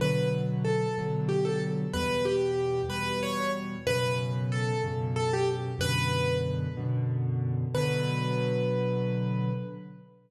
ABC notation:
X:1
M:6/8
L:1/16
Q:3/8=62
K:Bm
V:1 name="Acoustic Grand Piano"
B2 z2 A2 z2 G A z2 | B2 G4 B2 c2 z2 | B2 z2 A2 z2 A G z2 | B4 z8 |
B12 |]
V:2 name="Acoustic Grand Piano" clef=bass
[B,,D,F,]6 [B,,D,F,]6 | [E,,B,,G,]6 [E,,B,,G,]6 | [F,,B,,C,]6 [F,,B,,C,]6 | [F,,B,,D,]6 [F,,B,,D,]6 |
[B,,D,F,]12 |]